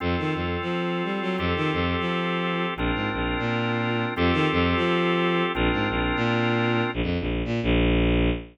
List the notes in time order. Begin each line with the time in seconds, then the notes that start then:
0.00 F2 C4 F4 A4
0.18 D#3
0.35 F2
0.61 F3
1.04 G3
1.21 F#3
1.38 F2 C4 F4 G4 A4
1.56 D#3
1.73 F2
1.99 F3
2.76 A#1 C4 D4 F4 A#4
2.95 G#2
3.13 A#1
3.39 A#2
4.16 F2 C4 F4 G4 A4
4.33 D#3
4.52 F2
4.76 F3
5.54 A#1 C4 D4 F4 A#4
5.72 G#2
5.89 A#1
6.16 A#2
6.94 A#1
7.03 F2
7.20 A#1
7.45 A#2
7.63 A#1